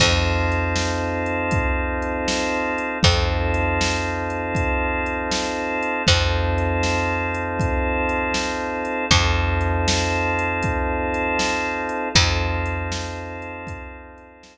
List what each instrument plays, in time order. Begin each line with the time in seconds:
0.00 electric bass (finger) F2, drawbar organ C4 D#4 F4 A4, kick, crash
0.52 closed hi-hat
0.76 snare
1.26 closed hi-hat
1.51 kick, closed hi-hat
2.02 closed hi-hat
2.28 snare
2.78 closed hi-hat
3.03 electric bass (finger) F2, drawbar organ C4 D#4 F4 A4, kick, closed hi-hat
3.54 closed hi-hat
3.81 snare
4.30 closed hi-hat
4.55 kick, closed hi-hat
5.06 closed hi-hat
5.31 snare
5.83 closed hi-hat
6.07 electric bass (finger) F2, drawbar organ C4 D#4 F4 A4, kick, closed hi-hat
6.58 closed hi-hat
6.83 snare
7.34 closed hi-hat
7.59 kick, closed hi-hat
8.09 closed hi-hat
8.34 snare
8.85 closed hi-hat
9.11 electric bass (finger) F2, drawbar organ C4 D#4 F4 A4, kick, closed hi-hat
9.61 closed hi-hat
9.88 snare
10.39 closed hi-hat
10.63 kick, closed hi-hat
11.14 closed hi-hat
11.39 snare
11.89 closed hi-hat
12.15 electric bass (finger) F2, drawbar organ C4 D#4 F4 A4, kick, closed hi-hat
12.66 closed hi-hat
12.92 snare
13.42 closed hi-hat
13.67 kick, closed hi-hat
14.18 closed hi-hat
14.43 snare